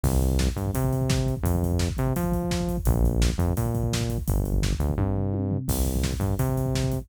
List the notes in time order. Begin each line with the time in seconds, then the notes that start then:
0.03 C2, kick, crash
0.13 kick
0.21 kick, closed hi-hat
0.31 kick
0.39 kick, snare
0.47 kick
0.56 G2, kick, closed hi-hat
0.66 kick
0.74 C3, kick, closed hi-hat
0.84 kick
0.93 kick, closed hi-hat
1.01 kick
1.10 kick, snare
1.18 kick
1.26 kick, closed hi-hat
1.36 kick
1.43 F2, kick, closed hi-hat
1.55 kick
1.63 kick, closed hi-hat
1.72 kick
1.79 kick, snare
1.89 kick
1.97 C3, kick, closed hi-hat
2.07 kick
2.16 F3, kick, closed hi-hat
2.24 kick
2.32 kick, closed hi-hat
2.43 kick
2.51 kick, snare
2.60 kick
2.68 kick, closed hi-hat
2.77 kick
2.85 A#1, kick, closed hi-hat
2.95 kick
3.04 kick, closed hi-hat
3.12 kick
3.22 kick, snare
3.30 kick
3.38 F2, kick, closed hi-hat
3.49 kick
3.57 A#2, kick, closed hi-hat
3.66 kick
3.75 kick, closed hi-hat
3.83 kick
3.93 kick, snare
4.00 kick
4.09 kick, closed hi-hat
4.18 kick
4.28 G1, kick, closed hi-hat
4.37 kick
4.45 kick, closed hi-hat
4.53 kick
4.62 kick, snare
4.72 kick
4.79 D2, kick, closed hi-hat
4.89 kick
4.98 G2, kick, high tom
5.16 floor tom
5.34 high tom
5.51 floor tom
5.68 C2, kick, crash
5.77 kick
5.85 kick, closed hi-hat
5.95 kick
6.04 kick, snare
6.12 kick
6.20 G2, kick, closed hi-hat
6.29 kick
6.39 C3, kick, closed hi-hat
6.49 kick
6.57 kick, closed hi-hat
6.66 kick
6.75 kick, snare
6.84 kick
6.92 kick, closed hi-hat
7.01 kick